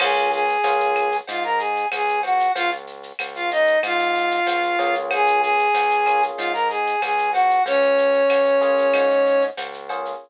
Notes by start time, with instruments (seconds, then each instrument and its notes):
0.00 synth bass 1 C#2, electric piano 1 A#3 C#4 F4 G#4, flute G#4 G#5, crash, cowbell, claves
0.16 shaker
0.32 flute G#4 G#5, shaker
0.48 shaker
0.64 synth bass 1 C#2, electric piano 1 A#3 C#4 F4 G#4, tambourine, cowbell, shaker
0.80 shaker
0.95 claves, shaker
1.12 shaker
1.28 synth bass 1 G#2, flute F4 F5, cowbell, shaker
1.44 flute A#4 A#5, shaker
1.58 flute G#4 G#5, shaker
1.76 shaker
1.91 synth bass 1 C#2, flute G#4 G#5, tambourine, cowbell, claves, shaker
2.08 shaker
2.23 flute F#4 F#5, cowbell, shaker
2.40 shaker
2.55 synth bass 1 C#2, flute F4 F5, cowbell, shaker
2.71 shaker
2.87 shaker
3.03 shaker
3.19 synth bass 1 C#2, tambourine, cowbell, claves, shaker
3.35 flute F4 F5, shaker
3.51 flute D#4 D#5, shaker
3.67 shaker
3.83 synth bass 1 G#2, flute F4 F5, cowbell, claves, shaker
3.99 shaker
4.15 shaker
4.31 shaker
4.47 synth bass 1 C#2, tambourine, cowbell, shaker
4.63 shaker
4.79 synth bass 1 C#2, electric piano 1 A#3 C#4 F4 G#4, cowbell, shaker
4.95 shaker
5.11 flute G#4 G#5, cowbell, claves, shaker
5.27 shaker
5.41 flute G#4 G#5, shaker
5.58 shaker
5.74 synth bass 1 C#2, tambourine, cowbell, shaker
5.90 shaker
6.06 electric piano 1 A#3 C#4 F4 G#4, claves, shaker
6.23 shaker
6.37 synth bass 1 G#2, flute F4 F5, cowbell, shaker
6.53 flute A#4 A#5, shaker
6.69 flute G#4 G#5, shaker
6.86 shaker
7.02 synth bass 1 C#2, flute G#4 G#5, tambourine, cowbell, claves, shaker
7.18 shaker
7.32 flute F#4 F#5, cowbell, shaker
7.50 shaker
7.66 synth bass 1 C#2, flute C#4 C#5, cowbell, shaker
7.82 shaker
7.98 shaker
8.14 shaker
8.30 synth bass 1 C#2, tambourine, cowbell, claves, shaker
8.46 shaker
8.61 electric piano 1 A#3 C#4 F4 G#4, shaker
8.78 shaker
8.93 synth bass 1 G#2, cowbell, claves, shaker
9.10 shaker
9.26 shaker
9.41 shaker
9.57 synth bass 1 C#2, tambourine, cowbell, shaker
9.73 shaker
9.89 electric piano 1 A#3 C#4 F4 G#4, cowbell, shaker
10.05 shaker